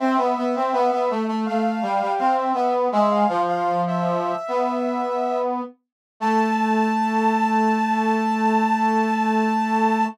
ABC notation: X:1
M:4/4
L:1/16
Q:1/4=82
K:Am
V:1 name="Ocarina"
e8 f4 f e e z | "^rit." e f2 f2 e9 z2 | a16 |]
V:2 name="Brass Section"
C B, B, C B, B, A, A, A,2 G, G, C2 B,2 | "^rit." ^G,2 F,6 B,6 z2 | A,16 |]